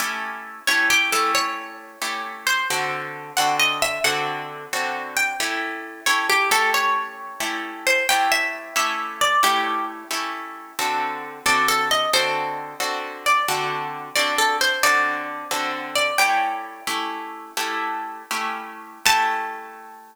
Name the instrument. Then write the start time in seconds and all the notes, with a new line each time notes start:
acoustic guitar (steel)
0.00 A3 C#4 E4 G4
0.67 A3 C#4 E4 G4 C#5
0.90 G4
1.12 A3 C#4 E4 G4 A4
1.35 C#5
2.02 A3 C#4 E4 G4
2.47 C5
2.70 D3 C4 F#4 A4
3.37 D3 C4 F#4 A4 F#5
3.60 D#5
3.82 E5
4.04 D3 C4 F#4 A4 F#5
4.73 D3 C4 F#4 A4
5.17 G5
5.40 A3 C#4 E4 G4
6.06 A3 C#4 E4 G4 C#5
6.29 G4
6.51 A3 C#4 E4 G4 A4
6.74 C#5
7.40 A3 C#4 E4 G4
7.87 C5
8.09 A3 C#4 E4 G4 G5
8.32 E5
8.76 A3 C#4 E4 G4 E5
9.21 D5
9.43 A3 C#4 E4 G4
10.11 A3 C#4 E4 G4
10.79 D3 C4 F#4 A4
11.46 D3 C4 F#4 A4 D5
11.68 A4
11.91 D#5
12.13 D3 C4 F#4 A4 C5
12.80 D3 C4 F#4 A4
13.26 D5
13.48 D3 C4 F#4 A4
14.16 D3 C4 F#4 A4 D5
14.38 A4
14.61 C5
14.83 D3 C4 F#4 A4 D5
15.51 D3 C4 F#4 A4
15.96 D5
16.18 A3 C#4 E4 G4 G5
16.87 A3 C#4 E4 G4
17.57 A3 C#4 E4 G4
18.31 A3 C#4 E4 G4
19.05 A3 C#4 E4 G4 A5